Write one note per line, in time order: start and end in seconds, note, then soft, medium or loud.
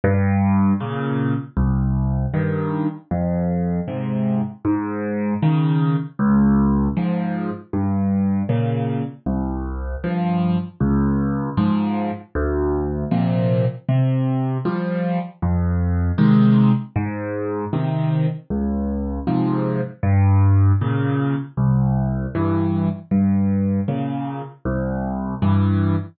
0.04 0.73 G2 medium
0.80 1.34 A#2 medium
0.80 1.34 C#3 medium
1.57 2.26 C2 medium
2.34 2.87 G2 medium
2.34 2.87 D#3 medium
3.11 3.80 F2 medium
3.88 4.42 G#2 medium
3.88 4.42 C3 medium
4.65 5.34 G#2 medium
5.42 5.96 C#3 medium
5.42 5.96 D#3 medium
6.19 6.88 C#2 medium
6.97 7.51 G#2 medium
6.97 7.51 F3 medium
7.73 8.43 G2 medium
8.49 9.03 A#2 medium
8.49 9.03 C#3 medium
9.26 9.96 C2 medium
10.04 10.58 G2 soft
10.04 10.58 F3 medium
10.80 11.50 C#2 medium
11.57 12.11 G#2 medium
11.57 12.11 F3 medium
12.35 13.04 D2 medium
13.11 13.65 A#2 medium
13.11 13.65 C3 medium
13.11 13.65 F3 medium
13.89 14.58 C3 medium
14.65 15.19 F3 medium
14.65 15.19 G3 medium
15.42 16.12 F2 medium
16.18 16.72 C3 medium
16.18 16.72 D#3 medium
16.18 16.72 G#3 medium
16.96 17.65 G#2 medium
17.73 18.27 C3 medium
17.73 18.27 D#3 medium
18.50 19.20 C#2 medium
19.27 19.81 G#2 medium
19.27 19.81 C3 medium
19.27 19.81 F3 medium
20.03 20.72 G2 medium
20.81 21.35 A#2 medium
20.81 21.35 C#3 medium
21.57 22.26 C2 medium
22.35 22.89 G2 medium
22.35 22.89 E3 medium
23.11 23.80 G2 medium
23.88 24.42 A#2 medium
23.88 24.42 C#3 medium
24.65 25.35 C2 medium
25.42 25.96 G2 medium
25.42 25.96 E3 medium